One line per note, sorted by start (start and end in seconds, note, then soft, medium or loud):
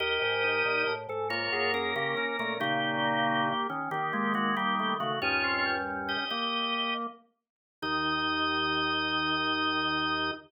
0.00 0.19 D#2 medium
0.00 0.93 G4 loud
0.00 0.94 A#4 loud
0.00 0.93 D#5 loud
0.22 0.63 G#2 medium
0.44 0.84 D#4 medium
0.65 0.85 A#2 medium
0.87 1.07 A2 medium
1.09 1.49 G#2 medium
1.09 1.28 A4 medium
1.30 2.53 A#3 medium
1.30 1.72 F4 loud
1.30 1.72 C#5 loud
1.52 1.94 F#2 medium
1.52 1.72 G#4 medium
1.74 1.95 C#4 loud
1.74 1.92 G#4 medium
1.74 1.95 A#4 loud
1.96 2.15 C#3 medium
1.96 2.36 C#4 medium
1.96 2.15 G4 medium
1.96 2.36 A#4 loud
2.17 2.37 C#4 medium
2.39 2.60 A#2 medium
2.39 2.58 A3 medium
2.39 2.58 C#4 medium
2.39 2.58 A#4 loud
2.60 3.53 A#2 medium
2.60 3.53 C#3 loud
2.60 3.67 A#3 loud
2.60 3.49 D#4 medium
2.60 3.67 G4 loud
3.04 3.41 A#3 medium
3.70 3.89 D#3 medium
3.70 3.90 C#4 medium
3.91 5.13 D#3 medium
3.91 4.12 D#3 medium
3.91 4.33 A#3 medium
3.91 4.33 G4 loud
4.13 4.34 G#3 medium
4.13 4.33 A#3 medium
4.34 4.55 G#3 medium
4.34 4.54 A#3 medium
4.34 4.55 F#4 loud
4.57 4.95 G3 medium
4.57 4.75 A#3 medium
4.57 4.95 A#3 loud
4.57 4.95 G4 loud
4.79 4.98 A3 medium
5.00 5.20 C#3 medium
5.00 5.19 A3 medium
5.00 5.20 F#4 loud
5.22 6.17 D#2 medium
5.22 6.17 G2 medium
5.22 6.25 C#4 medium
5.22 5.42 D#4 medium
5.22 5.75 F4 loud
5.22 5.75 C#5 loud
5.44 5.63 C4 medium
5.65 6.24 G3 medium
6.09 6.29 G4 medium
6.09 6.29 D#5 medium
6.30 7.07 A#3 medium
6.30 6.94 G4 medium
6.30 6.94 D#5 loud
7.82 10.31 D#2 loud
7.82 10.32 D#3 loud
7.82 10.31 D#4 loud
7.82 10.31 D#5 loud